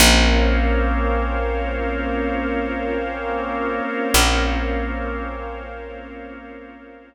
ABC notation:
X:1
M:4/4
L:1/8
Q:1/4=58
K:Bbdor
V:1 name="Drawbar Organ"
[B,CDF]8- | [B,CDF]8 |]
V:2 name="Pad 5 (bowed)"
[Bcdf]8- | [Bcdf]8 |]
V:3 name="Electric Bass (finger)" clef=bass
B,,,8 | B,,,8 |]